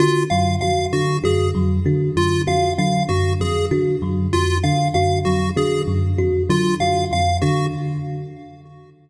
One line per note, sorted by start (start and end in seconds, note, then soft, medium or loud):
0.00 0.25 D3 medium
0.00 0.24 F4 medium
0.00 0.25 F#4 medium
0.30 0.56 F#2 medium
0.30 0.56 F#3 medium
0.30 0.55 F5 medium
0.61 0.86 F2 medium
0.61 0.87 F#4 medium
0.61 0.86 F5 medium
0.93 1.18 D3 medium
0.93 1.17 F#4 medium
1.24 1.49 F#2 medium
1.24 1.48 F#4 medium
1.24 1.49 G#4 medium
1.55 1.79 F2 medium
1.55 1.80 F#3 medium
1.85 2.10 D3 medium
1.85 2.11 F#4 medium
2.16 2.41 F#2 medium
2.16 2.42 F4 medium
2.47 2.72 F2 medium
2.47 2.72 F#4 medium
2.47 2.72 F5 medium
2.78 3.03 D3 medium
2.78 3.03 F#3 medium
2.78 3.03 F5 medium
3.09 3.34 F#2 medium
3.09 3.33 F#4 medium
3.09 3.34 F#4 medium
3.40 3.65 F2 medium
3.40 3.66 G#4 medium
3.71 3.96 D3 medium
3.71 3.96 F#4 medium
4.02 4.27 F#2 medium
4.02 4.27 F#3 medium
4.33 4.58 F2 medium
4.33 4.58 F4 medium
4.33 4.58 F#4 medium
4.64 4.89 D3 medium
4.64 4.88 F5 medium
4.94 5.20 F#2 medium
4.94 5.20 F#4 medium
4.94 5.19 F5 medium
5.25 5.51 F2 medium
5.25 5.51 F#3 medium
5.25 5.50 F#4 medium
5.56 5.82 D3 medium
5.56 5.81 F#4 medium
5.56 5.82 G#4 medium
5.88 6.12 F#2 medium
6.18 6.43 F2 medium
6.18 6.43 F#4 medium
6.49 6.74 D3 medium
6.49 6.74 F#3 medium
6.49 6.75 F4 medium
6.80 7.05 F#2 medium
6.80 7.05 F#4 medium
6.80 7.05 F5 medium
7.11 7.36 F2 medium
7.11 7.37 F5 medium
7.42 7.67 D3 medium
7.42 7.66 F#4 medium
7.42 7.67 F#4 medium